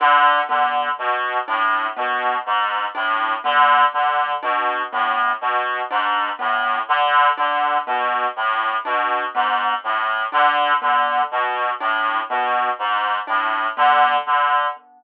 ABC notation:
X:1
M:6/8
L:1/8
Q:3/8=41
K:none
V:1 name="Clarinet" clef=bass
D, D, B,, A,, B,, ^G,, | A,, D, D, B,, A,, B,, | ^G,, A,, D, D, B,, A,, | B,, ^G,, A,, D, D, B,, |
A,, B,, ^G,, A,, D, D, |]
V:2 name="Marimba"
D B, z D B, z | D B, z D B, z | D B, z D B, z | D B, z D B, z |
D B, z D B, z |]